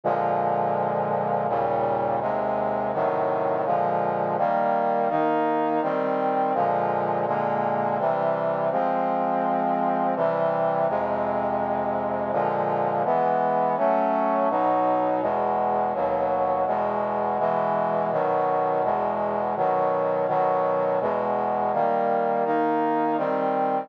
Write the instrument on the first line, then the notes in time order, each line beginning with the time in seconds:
brass section
0.04 A#2 D3 F3 G#3
1.48 D#2 A#2 C#3 G3
2.20 D#2 C3 G#3
2.93 A2 C3 D#3 F#3
3.65 A#2 D3 F3 G#3
4.37 D#3 G3 A#3
5.09 D#3 A#3 D#4
5.82 D#3 G3 C4
6.54 A#2 D3 F3 G#3
7.26 A#2 D3 G#3 A#3
7.98 C3 E3 G3
8.71 F3 G#3 C4
10.15 C3 E3 G3
10.88 F2 C3 G#3
12.32 A#2 D3 F3 G#3
13.04 E3 G#3 B3
13.77 F#3 A3 C#4
14.50 B2 F#3 D#4
15.21 E2 B2 G#3
15.94 D#2 B2 F#3
16.66 E2 B2 G#3
17.39 B2 E3 G#3
18.11 B2 D#3 F#3
18.83 E2 B2 G#3
19.56 B2 D#3 F#3
20.27 B2 D#3 F#3
21.00 E2 B2 G#3
21.72 D#3 G3 A#3
22.45 D#3 A#3 D#4
23.17 D#3 G3 C4